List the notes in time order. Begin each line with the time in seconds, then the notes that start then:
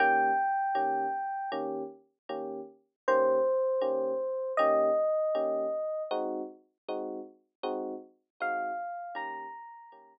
0.00 D#3 A#3 C#4 G4 G5
0.75 D#3 A#3 C#4 G4
1.52 D#3 A#3 C#4 G4
2.29 D#3 A#3 C#4 G4
3.08 D#3 A#3 C#4 G4 C5
3.81 D#3 A#3 C#4 G4
4.57 D#3 A#3 C#4 G4 D#5
5.35 D#3 A#3 C#4 G4
6.11 G#3 C4 D#4 F#4
6.89 G#3 C4 D#4 F#4
7.63 G#3 C4 D#4 F#4
8.40 G#3 C4 D#4 F#4 F5
9.15 D#3 A#3 C#4 G4 A#5
9.92 D#3 A#3 C#4 G4